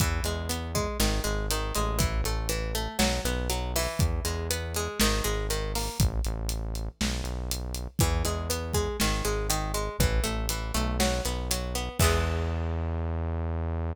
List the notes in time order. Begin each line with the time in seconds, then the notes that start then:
0.00 E2 E3, kick, closed hi-hat
0.24 E2 G#3, closed hi-hat
0.49 B3, closed hi-hat
0.75 G#3, kick, closed hi-hat
0.99 G#1 D#3, snare
1.24 G#1 G#3, closed hi-hat
1.51 D#3, closed hi-hat
1.75 A1 G#3, closed hi-hat
1.99 E3, kick, closed hi-hat
2.24 A1 A3, closed hi-hat
2.49 E3, closed hi-hat
2.75 A3, closed hi-hat
2.99 B1 F#3, snare
3.24 B1 B3, closed hi-hat
3.50 F#3, closed hi-hat
3.76 E3, open hi-hat
3.99 E2, kick, closed hi-hat
4.25 E2 G#3, closed hi-hat
4.51 B3, closed hi-hat
4.74 G#3, closed hi-hat
5.00 G#1 D#3, snare
5.24 G#1 G#3, closed hi-hat
5.50 D#3, closed hi-hat
5.75 A#3, open hi-hat
5.99 A1, kick, closed hi-hat
6.24 A1, closed hi-hat
6.49 closed hi-hat
6.75 closed hi-hat
7.01 B1, snare
7.24 B1, closed hi-hat
7.51 closed hi-hat
7.74 closed hi-hat
7.99 E2 E3, kick, closed hi-hat
8.25 E2 G#3, closed hi-hat
8.50 B3, closed hi-hat
8.73 G#3, kick, closed hi-hat
9.00 G#1 D#3, snare
9.25 G#1 G#3, closed hi-hat
9.50 D#3, closed hi-hat
9.74 G#3, closed hi-hat
9.99 A1 E3, kick, closed hi-hat
10.24 A1 A3, closed hi-hat
10.49 E3, closed hi-hat
10.74 B1 A3, closed hi-hat
11.00 F#3, snare
11.25 B1 B3, closed hi-hat
11.51 F#3, closed hi-hat
11.75 B3, closed hi-hat
11.99 E2 E3 G#3, kick, crash
12.04 B3